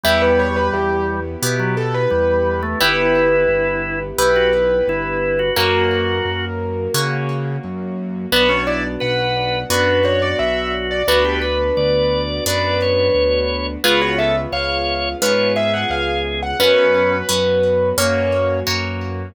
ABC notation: X:1
M:4/4
L:1/16
Q:1/4=87
K:Bm
V:1 name="Acoustic Grand Piano"
e B c B G2 z4 A B5 | B8 B8 | ^A10 z6 | B c d z f4 B2 c d e2 z d |
B8 B8 | B c e z ^e4 B2 =e f ^e2 z f | B8 c4 z4 |]
V:2 name="Drawbar Organ"
G,8 z F, z2 G,3 A, | E8 z F z2 E3 F | F6 z10 | B, C E z B4 F2 F6 |
F G B z d4 d2 c6 | ^E F A z c4 c2 ^G6 | C4 z12 |]
V:3 name="Orchestral Harp"
[B,EG]8 [B,EG]8 | [B,EG]8 [B,EG]8 | [^A,CF]8 [A,CF]8 | [B,DF]8 [B,DF]8 |
[B,DF]8 [B,DF]8 | [B,C^E^G]8 [B,CEG]8 | [B,CF]4 [B,CF]4 [^A,CF]4 [A,CF]4 |]
V:4 name="Acoustic Grand Piano" clef=bass
E,,4 E,,4 B,,4 E,,4 | G,,,4 G,,,4 B,,,4 G,,,4 | F,,4 F,,4 C,4 F,,4 | B,,,4 B,,,4 F,,4 B,,,4 |
D,,4 D,,4 F,,4 D,,4 | C,,4 C,,4 ^G,,4 C,,4 | F,,4 F,,4 F,,4 F,,4 |]
V:5 name="String Ensemble 1"
[B,EG]16 | [B,EG]16 | [^A,CF]16 | [B,DF]16 |
[B,DF]16 | [B,C^E^G]16 | [B,CF]8 [^A,CF]8 |]